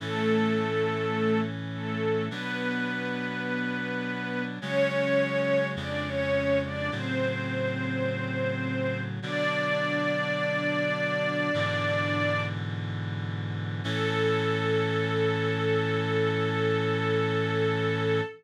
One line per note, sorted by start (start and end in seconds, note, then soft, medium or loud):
0.00 2.29 A2 medium
0.00 2.29 E3 medium
0.00 1.40 A3 medium
0.00 2.29 C#4 medium
0.00 1.40 A4 medium
1.74 2.25 A3 medium
1.74 2.25 A4 medium
2.31 4.59 B2 medium
2.31 4.59 F#3 medium
2.31 4.43 B3 medium
2.31 4.59 D4 medium
2.31 4.43 B4 medium
4.60 5.76 C#3 medium
4.60 5.76 F#3 medium
4.60 5.76 G#3 medium
4.60 5.66 C#4 medium
4.60 5.66 C#5 loud
5.76 6.90 F2 medium
5.76 6.90 C#3 medium
5.76 6.90 G#3 medium
5.76 6.06 D4 medium
5.76 6.06 D5 medium
6.06 6.59 C#4 medium
6.06 6.59 C#5 medium
6.64 6.91 D4 medium
6.64 6.91 D5 medium
6.91 9.20 A2 medium
6.91 9.20 C#3 medium
6.91 9.20 F#3 medium
6.91 9.00 C4 medium
6.91 9.00 C5 medium
9.22 11.51 B2 medium
9.22 11.51 D3 medium
9.22 11.51 F#3 medium
9.22 12.42 D4 loud
9.22 12.42 D5 loud
11.54 13.82 G#2 medium
11.54 13.82 B2 medium
11.54 13.82 D3 medium
11.54 13.82 E3 medium
13.84 18.21 A2 loud
13.84 18.21 E3 loud
13.84 18.21 C#4 loud
13.84 18.23 A4 loud